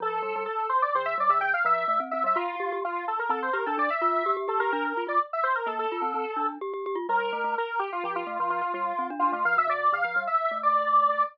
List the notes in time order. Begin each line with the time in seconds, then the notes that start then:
0.00 F3 A4
0.23 G3
0.36 G3
0.46 A4
0.69 C5
0.82 D5
0.95 D3 C5
1.05 E5
1.18 G3 D5
1.30 D3 E5
1.41 D3 G5
1.53 F5
1.65 F3 E5
1.88 A3
2.00 C4
2.11 C4 E5
2.24 G3 E5
2.36 F4
2.60 G4
2.72 G4
2.84 F4
3.08 A4
3.19 A#4
3.29 C4 A4
3.42 C5
3.53 G4 A#4
3.66 D4 A4
3.78 D4 D5
3.90 E5
4.01 F4 E5
4.26 G4
4.37 G4
4.48 G4 A4
4.60 G4 A#4
4.72 D4 A#4
4.85 A#4
4.97 F4
5.07 F4 D5
5.33 E5
5.43 C5
5.55 A#4
5.66 A#3 A4
5.79 A4
5.92 F4
6.02 C4
6.14 C4
6.36 D4
6.61 G4
6.74 G4
6.86 G4
6.95 F4
7.09 G3 A#4
7.33 A3
7.44 A3
7.58 A#4
7.79 G4
7.92 F4
8.04 F3 G4
8.16 F4
8.26 A3 F4
8.39 F3 F4
8.50 F3 F4
8.61 F4
8.74 G3 F4
8.99 C4
9.10 D4
9.19 D4 F4
9.32 A3 F4
9.45 F3 F5
9.57 C3 E5
9.68 C3 D5
9.92 D3 F5
10.04 F3
10.16 G3
10.27 E5
10.51 A3
10.63 D5